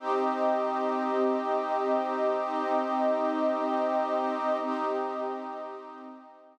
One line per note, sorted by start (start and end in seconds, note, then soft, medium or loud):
0.00 2.28 C4 loud
0.00 4.57 C4 medium
0.00 4.57 D#4 medium
0.00 2.28 G4 medium
0.00 4.57 G4 medium
0.00 2.28 D#5 medium
2.31 4.59 C4 loud
2.31 4.59 D#4 medium
2.31 4.59 D#5 loud
4.62 5.76 C4 medium
4.62 6.58 C4 medium
4.62 6.58 D#4 medium
4.62 5.76 G4 loud
4.62 6.58 G4 medium
4.62 5.76 D#5 medium
5.77 6.58 C4 loud
5.77 6.58 D#4 medium
5.77 6.58 D#5 medium